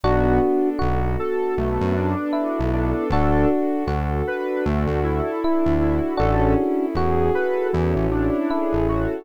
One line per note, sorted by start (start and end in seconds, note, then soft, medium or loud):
0.04 0.39 B1 loud
0.04 0.39 B3 loud
0.04 1.56 B3 medium
0.04 1.56 D4 medium
0.04 0.69 D4 medium
0.04 1.56 F#4 medium
0.04 0.40 F#4 loud
0.04 0.69 F#4 loud
0.04 1.56 A4 medium
0.42 0.78 D4 medium
0.79 1.17 B1 loud
0.79 2.08 F#4 medium
0.79 1.16 F#4 loud
1.19 1.54 A4 medium
1.19 1.55 A4 medium
1.57 1.78 B1 medium
1.57 1.95 A3 loud
1.57 1.93 B3 medium
1.57 3.10 B3 medium
1.57 3.10 D4 medium
1.57 3.10 A4 medium
1.57 3.10 B4 medium
1.81 2.15 F#2 loud
1.96 2.31 D4 medium
1.96 2.61 D4 loud
2.33 3.05 E4 medium
2.33 2.70 F#4 medium
2.59 2.93 B1 loud
2.73 3.08 D4 loud
2.73 3.08 A4 loud
3.10 3.45 D2 loud
3.10 4.64 D4 medium
3.10 3.47 D4 loud
3.10 3.84 D4 medium
3.10 4.64 F#4 medium
3.10 3.84 F#4 medium
3.10 4.64 A4 medium
3.10 3.49 A4 loud
3.49 3.85 F#4 medium
3.87 4.22 D2 loud
3.87 5.30 F#4 medium
3.87 4.24 A4 medium
4.27 4.62 D4 medium
4.27 4.65 B4 loud
4.65 4.86 D2 loud
4.65 4.99 A3 loud
4.65 6.18 D4 medium
4.65 5.01 F#4 loud
4.65 6.18 A4 medium
4.65 6.18 D5 medium
4.87 5.21 D2 loud
5.04 5.74 E4 loud
5.04 5.39 A4 medium
5.42 5.78 D4 medium
5.42 6.14 E4 medium
5.66 6.00 D2 loud
5.80 6.13 E4 medium
5.80 6.17 F#4 medium
6.17 6.55 A1 loud
6.17 7.72 C#4 medium
6.17 6.55 C#4 loud
6.17 6.86 D4 medium
6.17 7.72 E4 medium
6.17 6.86 F#4 medium
6.17 7.72 G#4 medium
6.17 7.72 A4 medium
6.17 6.54 A4 loud
6.58 6.94 E4 medium
6.95 7.30 E2 medium
6.95 8.36 F#4 medium
6.95 7.31 G#4 loud
7.35 7.70 A4 medium
7.35 7.67 B4 loud
7.73 7.95 E2 loud
7.73 8.07 E3 loud
7.73 8.08 C#4 medium
7.73 9.25 C#4 medium
7.73 9.25 E4 medium
7.73 9.25 A4 medium
7.73 9.25 C#5 medium
7.96 8.30 A1 medium
8.11 8.79 D4 loud
8.11 8.47 E4 loud
8.50 9.25 E4 medium
8.50 8.86 G#4 medium
8.73 9.07 A1 medium
8.88 9.22 F#4 medium
8.88 9.24 A4 medium